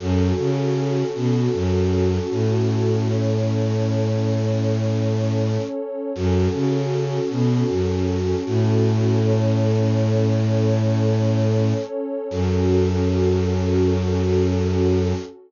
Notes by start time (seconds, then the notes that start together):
0.00 F#2 C#4 F#4 A4
0.38 C#3
1.15 B2
1.54 F#2
2.31 A2
3.08 C#4 A4 C#5
6.15 F#2 C#4 F#4 A4
6.54 C#3
7.31 B2
7.69 F#2
8.46 A2
9.23 C#4 A4 C#5
12.31 F#2 C#4 F#4 A4